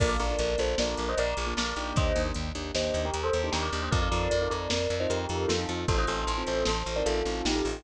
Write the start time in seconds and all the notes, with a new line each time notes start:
0.00 A#1 A#3 D4 F4 A4 A#4 D5, kick, crash
0.09 D5 F5
0.19 A#1 A#3 D4 F4 A4 A#4 D5, closed hi-hat
0.30 A#3 D4 F4 A4
0.39 A#1 A#4 D5, closed hi-hat
0.58 A#1 A#3 D4 F4 A4 C5, closed hi-hat
0.78 A#1 A#3 D4 F4 A4 A#4 D5, snare
0.97 A#1, closed hi-hat
1.09 C5 D#5
1.17 A#1 A#4 D5, closed hi-hat
1.37 A#1, closed hi-hat
1.47 A#3 D4 F4 A4
1.57 A#1 A#4 D5, snare
1.76 A#1 A#3 D4 D#4 G4, closed hi-hat
1.96 D#2 C5 D#5, kick, closed hi-hat
2.15 D#2 A#3 D4 D#4 G4, closed hi-hat
2.26 A#3 D4 D#4 G4
2.34 D#2, closed hi-hat
2.55 D#2 A#3 D4 D#4 G4, closed hi-hat
2.74 D#2 A#3 D4 D#4 G4 C5 D#5, snare
2.94 D#2, closed hi-hat
3.05 G4 A#4
3.14 D#2, closed hi-hat
3.23 A4 C5
3.33 D#2, closed hi-hat
3.44 A#3 D4 D#4 G4
3.52 D#2 G4 A#4, snare
3.62 A#4 D5
3.73 D#2 A#3 D4 D#4 G4, closed hi-hat
3.82 A#3 D4 D#4 G4 C5 D#5
3.91 F2 C4 D#4 F4 A4 A#4 D5, kick, closed hi-hat
4.02 C4 D#4 F4 A4 D5 F5
4.11 F2 C4 D#4 F4 A4 A#4 D5, closed hi-hat
4.31 F2 A#4 D5, closed hi-hat
4.41 C4 D#4 F4 A4
4.50 F2 A#4 D5, closed hi-hat
4.70 F2 A#4 D5, snare
4.90 F2, closed hi-hat
5.00 C4 D#4 F4 A4 C5 D#5
5.10 F2 G4 A#4, closed hi-hat
5.29 F2 C4 D#4 F4 A4, closed hi-hat
5.48 F2 F4 A4, snare
5.59 C4 D#4 F4 A4
5.69 F2 C4 D#4 F4 A4, closed hi-hat
5.88 A1 C4 D#4 F4 A4 C5, kick, closed hi-hat
5.98 C4 D#4 F4 A4 C5 D#5
6.07 A1 C4 D#4 F4 A4 C5, closed hi-hat
6.27 A1 A4 C5, closed hi-hat
6.38 C4 D#4 F4 A4
6.47 A1 A4 C5, closed hi-hat
6.65 A1 A4 C5, snare
6.86 A1, closed hi-hat
6.96 C4 D#4 F4 A4 A#4 D5
7.06 A1 F4 A4, closed hi-hat
7.25 A1 C4 D#4 F4 A4, closed hi-hat
7.45 A1 D#4 G4, snare
7.55 C4 D#4 F4 A4
7.65 A1 C4 D#4 F4 A4, open hi-hat